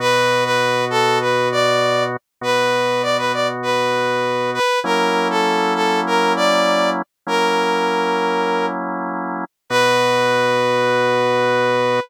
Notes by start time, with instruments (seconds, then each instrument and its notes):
0.00 drawbar organ B2 B3 F#4, brass section B4
0.45 brass section B4
0.90 brass section A4
1.21 brass section B4
1.52 brass section D5
2.41 drawbar organ B2 B3 F#4, brass section B4
3.03 brass section D5
3.18 brass section B4
3.33 brass section D5
3.63 brass section B4
4.54 brass section B4
4.84 drawbar organ F#3 A#3 C#4 E4, brass section A#4
5.30 brass section A4
5.75 brass section A4
6.07 brass section A#4
6.36 brass section D5
7.27 drawbar organ F#3 A#3 C#4 E4, brass section A#4
9.70 drawbar organ B2 B3 F#4, brass section B4